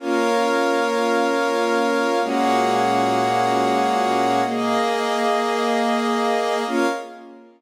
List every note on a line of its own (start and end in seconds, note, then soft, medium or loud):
0.00 2.20 A#3 loud
0.00 2.20 C#4 medium
0.00 2.20 F4 medium
0.00 2.20 A#4 loud
0.00 2.20 C#5 medium
0.00 2.20 F5 medium
2.22 4.42 A#2 loud
2.22 4.42 G#3 medium
2.22 4.42 A#3 loud
2.22 4.42 C#4 loud
2.22 4.42 F#4 medium
2.22 4.42 G#4 medium
2.22 4.42 C#5 medium
2.22 4.42 F#5 loud
4.44 6.64 A#3 medium
4.44 6.64 A#3 loud
4.44 6.64 G#4 medium
4.44 6.64 D#5 medium
6.67 6.86 A#3 loud
6.67 6.86 C#4 loud
6.67 6.86 F4 loud
6.67 6.87 A#4 loud
6.67 6.87 C#5 loud
6.67 6.87 F5 loud